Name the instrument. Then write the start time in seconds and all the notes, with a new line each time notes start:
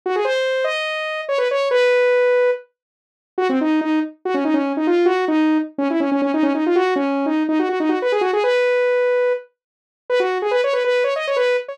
lead 2 (sawtooth)
0.06 F#4
0.16 G#4
0.25 C5
0.64 D#5
1.29 C#5
1.38 B4
1.51 C#5
1.71 B4
3.38 F#4
3.49 C4
3.61 D#4
3.81 D#4
4.25 F#4
4.34 C#4
4.45 D#4
4.54 C#4
4.77 D#4
4.87 F4
5.06 F#4
5.28 D#4
5.78 C#4
5.90 E4
6.00 C#4
6.12 C#4
6.22 C#4
6.34 D#4
6.43 C#4
6.55 D#4
6.66 F4
6.76 F#4
6.96 C#4
7.26 D#4
7.49 D#4
7.59 F#4
7.69 F#4
7.80 D#4
7.89 F#4
8.02 B4
8.12 G#4
8.21 F#4
8.33 G#4
8.44 B4
10.10 B4
10.20 F#4
10.42 G#4
10.51 B4
10.64 C#5
10.73 B4
10.84 B4
11.04 C#5
11.16 D#5
11.27 C#5
11.36 B4
11.68 C#5